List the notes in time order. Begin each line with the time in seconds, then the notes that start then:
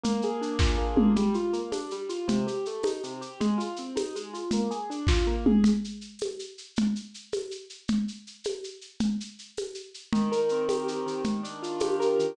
0.04 A#3, low conga, shaker
0.22 G#4, shaker
0.41 D4, shaker
0.59 F4, kick, snare
0.78 A#3
0.96 G#4, mid tom
1.16 G3, low conga, shaker
1.34 F4, shaker
1.53 A#3, shaker
1.72 D4, tambourine, high conga, shaker
1.90 G3, shaker
2.09 F4, shaker
2.28 C3, low conga, shaker
2.47 G4, shaker
2.65 A3, shaker
2.83 D#4, tambourine, high conga, shaker
3.04 C3, shaker
3.21 G4, shaker
3.40 G#3, low conga, shaker
3.58 F4, shaker
3.76 C4, shaker
3.96 D#4, tambourine, high conga, shaker
4.16 G#3, shaker
4.33 F4, shaker
4.51 A#3, low conga, shaker
4.71 G#4, shaker
4.90 D4, shaker
5.07 F4, kick, snare
5.27 A#3
5.46 G#4, mid tom
5.64 low conga, shaker
5.84 shaker
6.01 shaker
6.19 tambourine, high conga, shaker
6.39 shaker
6.58 shaker
6.76 low conga, shaker
6.96 shaker
7.14 shaker
7.32 tambourine, high conga, shaker
7.51 shaker
7.70 shaker
7.88 low conga, shaker
8.08 shaker
8.27 shaker
8.44 tambourine, high conga, shaker
8.64 shaker
8.81 shaker
9.00 low conga, shaker
9.20 shaker
9.39 shaker
9.57 tambourine, high conga, shaker
9.74 shaker
9.94 shaker
10.13 D#3, low conga, shaker
10.32 A#4, shaker
10.49 C4, shaker
10.69 G4, tambourine, high conga, shaker
10.88 D#3, shaker
11.06 D#3, shaker
11.24 low conga, shaker
11.43 D4, shaker
11.63 F4, shaker
11.80 G4, tambourine, high conga, shaker
12.00 A#4, shaker
12.19 D#3, shaker